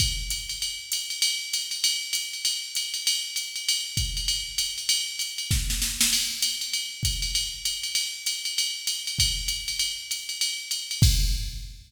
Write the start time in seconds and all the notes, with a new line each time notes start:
0.00 kick, ride
0.30 hi-hat pedal, ride
0.49 ride
0.62 ride
0.92 hi-hat pedal, ride
1.10 ride
1.22 ride
1.53 hi-hat pedal, ride
1.71 ride
1.84 ride
2.13 hi-hat pedal, ride
2.33 ride
2.45 ride
2.75 hi-hat pedal, ride
2.94 ride
3.07 ride
3.36 hi-hat pedal, ride
3.56 ride
3.69 ride
3.97 kick, hi-hat pedal, ride
4.17 ride
4.28 ride
4.58 hi-hat pedal, ride
4.78 ride
4.89 ride
5.19 hi-hat pedal, ride
5.38 ride
5.51 kick, snare
5.70 snare
5.82 snare
6.01 snare
6.13 crash, ride
6.42 hi-hat pedal, ride
6.61 ride
6.73 ride
7.03 kick, hi-hat pedal, ride
7.22 ride
7.35 ride
7.65 hi-hat pedal, ride
7.83 ride
7.95 ride
8.26 hi-hat pedal, ride
8.45 ride
8.58 ride
8.87 hi-hat pedal, ride
9.07 ride
9.19 kick, ride
9.48 hi-hat pedal, ride
9.68 ride
9.79 ride
10.11 hi-hat pedal, ride
10.29 ride
10.41 ride
10.71 hi-hat pedal, ride
10.91 ride
11.02 kick, crash